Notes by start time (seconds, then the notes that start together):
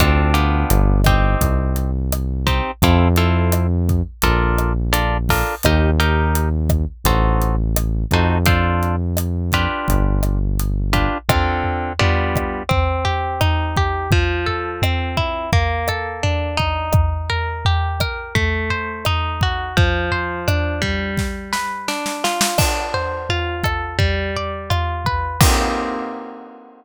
0.00 D2 C4 D4 F4 A4, kick, cross-stick, closed hi-hat
0.34 B3 D4 F4 G4, closed hi-hat
0.70 G1, closed hi-hat
1.04 C4 D#4 G4, kick, cross-stick, closed hi-hat
1.41 C2, kick, closed hi-hat
1.76 closed hi-hat
2.12 cross-stick, closed hi-hat
2.47 C4 D#4 G4, kick, closed hi-hat
2.82 F2 C4 E4 F4 A4, kick, closed hi-hat
3.16 C4 E4 F4 A4, closed hi-hat
3.52 cross-stick, closed hi-hat
3.89 kick, closed hi-hat
4.22 A#1 D4 F4 A4 A#4, kick, closed hi-hat
4.58 cross-stick, closed hi-hat
4.93 D4 F4 A4 A#4, closed hi-hat
5.29 D4 F4 A4 A#4, kick, open hi-hat
5.63 D#2 D#4 G4 A#4, kick, cross-stick, closed hi-hat
6.00 D#4 G4 A#4, closed hi-hat
6.35 closed hi-hat
6.69 kick, cross-stick, closed hi-hat
7.04 A1 D#4 F#4 A4 C5, kick, closed hi-hat
7.41 closed hi-hat
7.76 cross-stick, closed hi-hat
8.11 F2 D#4 F#4 A4 C5, kick, closed hi-hat
8.46 D4 F4 A4 C5, kick, closed hi-hat
8.83 closed hi-hat
9.17 cross-stick, closed hi-hat
9.52 D4 F4 G4 B4, kick, closed hi-hat
9.88 G1, kick, closed hi-hat
10.23 cross-stick, closed hi-hat
10.59 closed hi-hat
10.93 D4 F4 G4 B4, kick, closed hi-hat
11.29 D3 C4 F4 A4, kick, cross-stick, floor tom
11.64 floor tom
11.99 G3 B3 D4 F4, floor tom
12.36 kick, cross-stick, floor tom
12.69 C4, kick, floor tom
13.05 G4, floor tom
13.41 D#4, cross-stick, floor tom
13.77 G4, kick, floor tom
14.11 F3, kick, floor tom
14.46 A4, floor tom
14.82 C4, cross-stick, floor tom
15.17 E4, kick, floor tom
15.53 A#3, kick, floor tom
15.88 A4, cross-stick, floor tom
16.23 D4, floor tom
16.57 D#4, kick, floor tom
16.93 kick, cross-stick, floor tom
17.30 A#4, floor tom
17.65 G4, floor tom
18.00 A#4, kick, cross-stick, floor tom
18.35 A3, kick, floor tom
18.70 C5, floor tom
19.05 D#4, cross-stick, floor tom
19.41 F#4, kick, floor tom
19.77 F3, kick, floor tom
20.11 C5, floor tom
20.48 D4, cross-stick, floor tom
20.82 G3, kick, floor tom
21.17 kick, snare
21.53 B4, snare
21.88 D4, snare
22.06 snare
22.24 F4, snare
22.41 snare
22.58 D4, kick, cross-stick, crash
22.94 C5, floor tom
23.29 F4, floor tom
23.64 A4, kick, cross-stick, floor tom
23.99 G3, kick, floor tom
24.36 D5, floor tom
24.70 F4, cross-stick, floor tom
25.05 B4, kick, floor tom
25.41 A#3 C4 D#4 G4, kick, crash